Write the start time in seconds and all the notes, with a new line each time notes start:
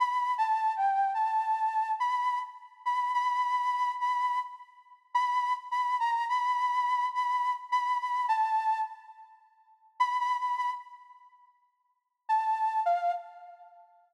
0.00 B5
0.38 A5
0.76 G5
1.14 A5
2.00 B5
2.85 B5
3.14 B5
4.00 B5
5.15 B5
5.71 B5
6.00 A#5
6.29 B5
7.14 B5
7.72 B5
8.00 B5
8.28 A5
10.00 B5
10.19 B5
10.38 B5
10.57 B5
12.29 A5
12.86 F5